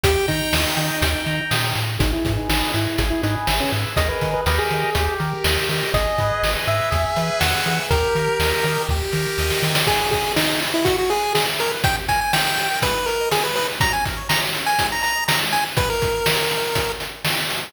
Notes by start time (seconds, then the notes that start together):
0.04 D#2 G4 G5, kick, closed hi-hat
0.28 D#3 D#4 A#5, kick, closed hi-hat
0.53 D#2 D#6, snare
0.76 D#3 G5, closed hi-hat
1.02 D#2 G5, kick, closed hi-hat
1.26 D#3 A#5, closed hi-hat
1.51 A#2 D#6, snare, closed hi-hat
1.75 A2 G5, closed hi-hat
1.99 G#1 D#4 G#4, kick, closed hi-hat
2.13 E4
2.25 G#2 B4, kick, closed hi-hat
2.37 D#4
2.49 G#1 D#4 D#5, snare
2.74 G#2 E4 G#4, closed hi-hat
2.98 G#1 G#4, kick, closed hi-hat
3.10 E4
3.23 G#2 D#4 B4, closed hi-hat
3.47 G#1 E5, snare
3.60 C#4
3.72 G#2 G#4, closed hi-hat
3.96 D#2 G#4 A#4 D#5, kick, closed hi-hat
4.09 B4
4.21 D#3, kick, closed hi-hat
4.34 B4
4.46 D#2 G4 A#4 B4 D#5, snare
4.59 G#4
4.70 D#3, closed hi-hat
4.95 D#2 G4, kick, closed hi-hat
5.20 D#3 A#4, closed hi-hat
5.44 D#2 D#5, snare
5.69 D#3 G4, open hi-hat
5.94 G#1 G#4 D#5, kick, closed hi-hat
6.18 G#2 B4, kick, closed hi-hat
6.42 G#1 D#5, snare
6.67 G#2 G#4 E5, closed hi-hat
6.91 E2 G#4, kick, closed hi-hat
7.16 E3 B4, closed hi-hat
7.40 E2 E5 F#5, snare
7.66 E3 G#4, closed hi-hat
7.90 D#2 G4 A#4, kick, closed hi-hat
8.15 D#3 A#4, closed hi-hat
8.39 D#2 D#5, snare
8.64 D#3 G4, closed hi-hat
8.89 D#2 G4, kick, snare
9.12 D#3 A#4, snare
9.38 D#2 D#5, snare
9.50 snare
9.63 D#3 G4, snare
9.75 snare
9.87 G#4, kick, crash
9.98 B4
10.11 G#4 D#5, kick, closed hi-hat
10.23 B5
10.36 D#4 D#6, snare
10.47 G#4
10.61 B4, closed hi-hat
10.74 E4 D#5
10.85 E4 F#4, kick, closed hi-hat
10.98 F#4 G#4
11.10 G#4 B4, closed hi-hat
11.23 G#5
11.35 G#4 B5, snare
11.47 E4
11.59 G#4 A#4, closed hi-hat
11.71 B4
11.84 D#4 G5, kick, closed hi-hat
11.95 G4
12.09 A#4 G#5, kick, closed hi-hat
12.21 G5 G#5
12.33 G5 A#5, snare
12.46 D#4
12.57 G4, closed hi-hat
12.71 A#4
12.82 G#3 B4, kick, closed hi-hat
12.94 D#4
13.06 A#4 B4, closed hi-hat
13.20 D#5
13.31 G#4 B5, snare
13.44 G#3 B4
13.56 D#4 B4, open hi-hat
13.69 B4
13.80 F#3 A#5, kick, closed hi-hat
13.91 C#4 G#5
14.05 A#4, kick, closed hi-hat
14.17 C#5
14.29 A#5, snare
14.41 F#3
14.54 C#4, closed hi-hat
14.66 A#4 G#5
14.79 G#3, kick, closed hi-hat
14.92 D#4 A#5
15.03 B4 A#5, closed hi-hat
15.16 D#5
15.28 A#5 B5, snare
15.41 G#3
15.52 D#4 G#5, closed hi-hat
15.64 B4
15.77 B4, kick, closed hi-hat
15.90 A#4
16.02 kick, closed hi-hat
16.26 snare
16.51 closed hi-hat
16.75 kick, closed hi-hat
17.00 closed hi-hat
17.25 snare
17.50 open hi-hat